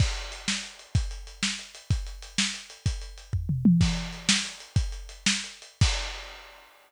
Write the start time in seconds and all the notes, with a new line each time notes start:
0.00 kick, crash
0.16 closed hi-hat
0.32 closed hi-hat
0.48 snare
0.63 closed hi-hat
0.79 closed hi-hat
0.95 kick, closed hi-hat
1.11 closed hi-hat
1.27 closed hi-hat
1.43 snare
1.59 closed hi-hat
1.75 closed hi-hat
1.90 kick, closed hi-hat
2.06 closed hi-hat
2.22 closed hi-hat
2.38 snare
2.54 closed hi-hat
2.70 closed hi-hat
2.86 kick, closed hi-hat
3.02 closed hi-hat
3.18 closed hi-hat
3.33 kick, floor tom
3.49 mid tom
3.65 high tom
3.81 kick, crash
3.97 closed hi-hat
4.13 closed hi-hat
4.29 snare
4.45 closed hi-hat
4.60 closed hi-hat
4.76 kick, closed hi-hat
4.92 closed hi-hat
5.09 closed hi-hat
5.26 snare
5.44 closed hi-hat
5.62 closed hi-hat
5.81 kick, crash